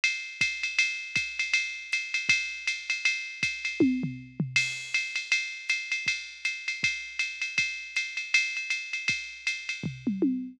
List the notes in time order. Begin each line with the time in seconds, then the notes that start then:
0.04 ride
0.41 kick, hi-hat pedal, ride
0.63 ride
0.79 ride
1.16 kick, hi-hat pedal, ride
1.39 ride
1.54 ride
1.92 hi-hat pedal, ride
2.14 ride
2.29 kick, ride
2.67 hi-hat pedal, ride
2.90 ride
3.05 ride
3.43 kick, hi-hat pedal, ride
3.65 ride
3.80 kick, high tom
4.03 floor tom
4.40 floor tom
4.56 crash, ride
4.94 ride
5.16 ride
5.32 ride
5.69 hi-hat pedal, ride
5.92 ride
6.06 kick, ride
6.45 hi-hat pedal, ride
6.68 ride
6.83 kick, ride
7.19 hi-hat pedal, ride
7.42 ride
7.58 kick, ride
7.96 hi-hat pedal, ride
8.17 ride
8.34 ride
8.57 ride
8.70 hi-hat pedal, ride
8.93 ride
9.08 kick, ride
9.47 hi-hat pedal, ride
9.69 ride
9.84 kick, floor tom
10.07 mid tom
10.22 high tom